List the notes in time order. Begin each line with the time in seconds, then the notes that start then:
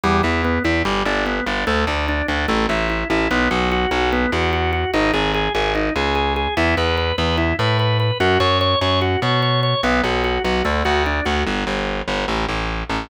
0.03 E2 G3
0.23 E2 E4
0.45 B3
0.64 E2 E4
0.85 G1 G3
1.05 G1 D4
1.26 B3
1.46 G1 D4
1.67 D2 A3
1.87 D2 D4
2.08 D4
2.28 D2 D4
2.48 A1 A3
2.69 A1 E4
2.90 E4
3.10 A1 E4
3.31 B1 B3
3.51 B1 F#4
3.72 F#4
3.91 B1 F#4
4.12 B3
4.32 E2 F#4
4.53 F#4
4.73 F#4
4.94 G#1 D#4
5.13 G#1 G#4
5.34 G#4
5.55 G#1 G#4
5.75 D#4
5.96 C#2 G#4
6.15 G#4
6.36 G#4
6.57 E2 E4
6.77 E2 B4
6.97 B4
7.18 E2 B4
7.38 E4
7.59 A2 B4
7.79 B4
8.00 B4
8.20 F#2 F#4
8.40 F#2 C#5
8.61 C#5
8.81 F#2 C#5
9.02 F#4
9.22 B2 C#5
9.42 C#5
9.63 C#5
9.83 B1 B3
10.04 B1 F#4
10.24 F#4
10.44 B1 F#4
10.65 D2 A3
10.85 D2 F#4
11.06 D4
11.25 D2 F#4
11.47 G1
11.67 G1
12.08 G1
12.28 A1
12.49 A1
12.90 A1